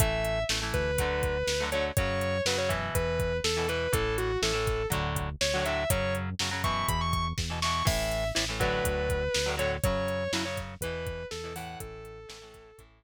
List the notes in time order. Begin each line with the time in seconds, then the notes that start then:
0.00 A1 E3 A3 E5, kick, closed hi-hat
0.25 closed hi-hat
0.49 A1 E3 A3, snare
0.62 E3 A3
0.74 D2 B4, kick, closed hi-hat
0.98 D3 F#3 A3, kick, closed hi-hat
1.23 kick, closed hi-hat
1.47 D2, snare, closed hi-hat
1.60 D3 F#3 A3
1.72 D3 F#3 A3 C#5, closed hi-hat
1.97 F#2 C#3 F#3 C#5, kick, closed hi-hat
2.21 closed hi-hat
2.45 F#2 C#3 F#3 B4, snare
2.57 C#3 F#3 C#5
2.69 B2 E3, kick, closed hi-hat
2.95 E2 B4, kick, closed hi-hat
3.20 kick, closed hi-hat
3.44 E2 A4, snare
3.57 B2 E3
3.68 B2 E3 B4, closed hi-hat
3.93 A1 A2 E3 A4, kick, closed hi-hat
4.18 F#4, closed hi-hat
4.42 A1 A2 E3 A4, snare
4.53 A2 E3
4.67 kick, closed hi-hat
4.90 D2 A2 D3 F#3, kick, closed hi-hat
5.16 kick, closed hi-hat
5.41 D2 C#5, snare
5.54 A2 D3 F#3
5.64 A2 D3 F#3 E5, closed hi-hat
5.90 F#2 C#3 F#3 C#5, kick, closed hi-hat
6.15 closed hi-hat
6.39 F#2 C#3 F#3, snare
6.51 C#3 F#3
6.64 B2 E3 C#6, kick, closed hi-hat
6.89 E2 B5, kick, closed hi-hat
7.01 C#6
7.13 C#6, kick, closed hi-hat
7.38 E2, kick, snare
7.50 B2 E3
7.62 B2 E3 C#6, snare
7.85 A1 A2 E3 E5, kick, crash
8.11 closed hi-hat
8.35 A1 A2 E3, snare
8.49 A2 E3
8.60 A2 D3 F#3 B4, kick, closed hi-hat
8.84 D2, kick, closed hi-hat
9.10 kick, closed hi-hat
9.34 D2, snare
9.46 A2 D3 F#3
9.57 A2 D3 F#3 C#5, closed hi-hat
9.84 F#2 C#3 F#3 C#5, kick, closed hi-hat
10.08 closed hi-hat
10.32 F#2 C#3 F#3 E4, snare
10.45 C#3 F#3 C#5
10.57 kick, closed hi-hat
10.81 E2 E3 B4, kick, closed hi-hat
10.85 B2
11.07 kick, closed hi-hat
11.31 E2 A4, snare
11.44 B2 E3
11.56 A2 E3 F#5, open hi-hat
11.80 A1 A4, kick, closed hi-hat
12.05 closed hi-hat
12.29 A1 A2 E3, snare
12.42 A2 E3
12.54 kick, closed hi-hat
12.78 A1 A2 E3, kick, closed hi-hat